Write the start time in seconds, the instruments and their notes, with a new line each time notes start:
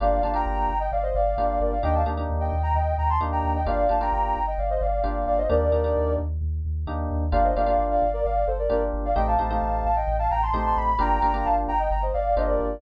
0.00 synth bass 2 G1, electric piano 1 A#3 D4 F4 G4, ocarina D5 F5
0.23 synth bass 2 G1, electric piano 1 A#3 D4 F4 G4, ocarina F5 A5
0.34 electric piano 1 A#3 D4 F4 G4, ocarina G5 A#5
0.46 synth bass 2 G1, ocarina G5 A#5
0.69 synth bass 2 G1
0.80 ocarina D#5 G5
0.92 synth bass 2 G1, ocarina D5 F5
1.03 ocarina C5 D#5
1.15 synth bass 2 G1, ocarina D5 F5
1.37 synth bass 2 G1, electric piano 1 A#3 D4 F4 G4
1.60 synth bass 2 G1, ocarina A#4 D5
1.72 ocarina D5 F5
1.83 synth bass 2 D#2, electric piano 1 A#3 D4 D#4 G4, ocarina D#5 G5
1.95 ocarina F5 A5
2.05 synth bass 2 D#2, electric piano 1 A#3 D4 D#4 G4
2.17 electric piano 1 A#3 D4 D#4 G4
2.30 synth bass 2 D#2
2.40 ocarina D#5 G5
2.53 synth bass 2 D#2
2.63 ocarina G5 A#5
2.74 synth bass 2 D#2, ocarina D#5 G5
2.98 synth bass 2 D#2, ocarina G5 A#5
3.10 ocarina A5 C6
3.21 synth bass 2 D#2, electric piano 1 A#3 D4 D#4 G4
3.32 ocarina G5 A#5
3.43 synth bass 2 D#2
3.55 ocarina D#5 G5
3.66 synth bass 2 G1, electric piano 1 A#3 D4 F4 G4, ocarina D5 F5
3.89 synth bass 2 G1, electric piano 1 A#3 D4 F4 G4, ocarina F5 A5
4.01 electric piano 1 A#3 D4 F4 G4, ocarina G5 A#5
4.12 synth bass 2 G1, ocarina G5 A#5
4.36 synth bass 2 G1
4.47 ocarina D#5 G5
4.58 synth bass 2 G1, ocarina D5 F5
4.70 ocarina C5 D#5
4.81 synth bass 2 G1, ocarina D5 F5
5.04 synth bass 2 G1, electric piano 1 A#3 D4 F4 G4
5.27 synth bass 2 G1, ocarina D5 F5
5.38 ocarina C5 D#5
5.50 synth bass 2 D#2, electric piano 1 A#3 D4 D#4 G4, ocarina A#4 D5
5.72 synth bass 2 D#2, electric piano 1 A#3 D4 D#4 G4
5.84 electric piano 1 A#3 D4 D#4 G4
5.96 synth bass 2 D#2
6.18 synth bass 2 D#2
6.41 synth bass 2 D#2
6.65 synth bass 2 D#2
6.87 synth bass 2 D#2, electric piano 1 A#3 D4 D#4 G4
7.10 synth bass 2 D#2
7.32 synth bass 2 G1, electric piano 1 A#3 D4 F4 G4, ocarina D5 F5
7.44 ocarina C5 D#5
7.55 synth bass 2 G1, electric piano 1 A#3 D4 F4 G4, ocarina D5 F5
7.66 electric piano 1 A#3 D4 F4 G4
7.78 synth bass 2 G1
7.90 ocarina D5 F5
8.02 synth bass 2 G1
8.13 ocarina A#4 D5
8.24 synth bass 2 G1, ocarina D5 F5
8.47 synth bass 2 G1, ocarina A4 C5
8.59 ocarina A#4 D5
8.70 synth bass 2 G1, electric piano 1 A#3 D4 F4 G4, ocarina A#4 D5
8.93 synth bass 2 G1
9.05 ocarina D5 F5
9.16 synth bass 2 A1, electric piano 1 A3 C4 D#4 G4, ocarina D#5 G5
9.27 ocarina F5 A5
9.39 synth bass 2 A1, electric piano 1 A3 C4 D#4 G4, ocarina F5 A5
9.50 electric piano 1 A3 C4 D#4 G4
9.62 synth bass 2 A1
9.84 synth bass 2 A1, ocarina F5 A5
9.96 ocarina D#5 G5
10.07 synth bass 2 A1
10.19 ocarina F5 A5
10.30 synth bass 2 A1, ocarina G5 A#5
10.43 ocarina A5 C6
10.53 synth bass 2 A1, electric piano 1 A3 C4 D#4 G4
10.66 ocarina A5 C6
10.77 synth bass 2 A1, ocarina B5
10.99 synth bass 2 G1, electric piano 1 A#3 D4 F4 G4, ocarina G5 A#5
11.22 synth bass 2 G1, electric piano 1 A#3 D4 F4 G4
11.34 electric piano 1 A#3 D4 F4 G4
11.45 synth bass 2 G1, ocarina F5 A5
11.68 synth bass 2 G1, ocarina G5 A#5
11.79 ocarina D#5 G5
11.91 synth bass 2 G1, ocarina G5 A#5
12.02 ocarina C5 D#5
12.14 synth bass 2 G1, ocarina D5 F5
12.36 synth bass 2 G1, electric piano 1 A#3 D4 F4 G4, ocarina C5 D#5
12.47 ocarina A#4 D5
12.60 synth bass 2 G1